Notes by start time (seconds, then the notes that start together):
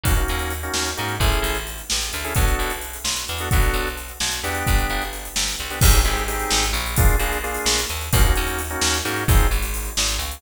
0.03 D#2 A#3 C#4 D#4 F#4, kick, closed hi-hat
0.16 A#3 C#4 D#4 F#4, closed hi-hat
0.28 D#2, closed hi-hat
0.39 closed hi-hat
0.50 closed hi-hat
0.63 A#3 C#4 D#4 F#4, closed hi-hat
0.74 D#2, snare
0.85 closed hi-hat
0.97 G#2 A#3 C#4 D#4 F#4, closed hi-hat
1.08 closed hi-hat
1.20 A1 C#4 E4 G#4 A4, kick, closed hi-hat
1.32 closed hi-hat
1.42 A1, closed hi-hat
1.55 closed hi-hat
1.67 closed hi-hat
1.78 closed hi-hat
1.90 A1, snare
2.01 closed hi-hat
2.13 D2, closed hi-hat
2.24 C#4 E4 G#4 A4, closed hi-hat
2.35 B1 B3 D4 F#4 A4, kick, closed hi-hat
2.47 closed hi-hat
2.59 B1, closed hi-hat
2.70 closed hi-hat
2.81 closed hi-hat
2.93 closed hi-hat
3.04 B1, snare
3.16 closed hi-hat
3.28 E2, closed hi-hat
3.38 B3 D4 F#4 A4, closed hi-hat
3.51 B1 B3 D4 F#4 A4, kick, closed hi-hat
3.62 closed hi-hat
3.73 B1, closed hi-hat
3.87 closed hi-hat
3.97 closed hi-hat
4.08 closed hi-hat
4.20 B1, snare
4.31 closed hi-hat
4.43 E2 B3 D4 G4, closed hi-hat
4.55 closed hi-hat
4.67 G1, kick, closed hi-hat
4.78 closed hi-hat
4.90 G1, closed hi-hat
5.02 closed hi-hat
5.13 closed hi-hat
5.25 closed hi-hat
5.36 G1, snare
5.48 closed hi-hat
5.59 C2, closed hi-hat
5.70 B3 D4 G4, closed hi-hat
5.81 G#1 C4 D#4 G4 G#4, kick, crash
5.94 closed hi-hat
6.05 G#1 C4 D#4 G4 G#4, closed hi-hat
6.17 closed hi-hat
6.28 C4 D#4 G4 G#4, closed hi-hat
6.39 closed hi-hat
6.50 G#1, snare
6.63 closed hi-hat
6.73 A#1, closed hi-hat
6.86 closed hi-hat
6.96 A#3 D4 F4 G#4, kick, closed hi-hat
7.08 closed hi-hat
7.19 A#1 A#3 D4 F4 G#4, closed hi-hat
7.32 closed hi-hat
7.44 A#3 D4 F4 G#4, closed hi-hat
7.54 closed hi-hat
7.66 A#1, snare
7.78 closed hi-hat
7.89 D#2, closed hi-hat
8.01 closed hi-hat
8.13 D#2 A#3 C#4 D#4 F#4, kick, closed hi-hat
8.24 A#3 C#4 D#4 F#4, closed hi-hat
8.35 D#2, closed hi-hat
8.47 closed hi-hat
8.59 closed hi-hat
8.70 A#3 C#4 D#4 F#4, closed hi-hat
8.81 D#2, snare
8.94 closed hi-hat
9.05 G#2 A#3 C#4 D#4 F#4, closed hi-hat
9.16 closed hi-hat
9.28 G#1 C4 D#4 F4 G#4, kick, closed hi-hat
9.40 closed hi-hat
9.51 G#1 G#3, closed hi-hat
9.62 closed hi-hat
9.74 closed hi-hat
9.85 closed hi-hat
9.97 G#1 G#3, snare
10.08 closed hi-hat
10.18 C#2 C#3, closed hi-hat
10.31 closed hi-hat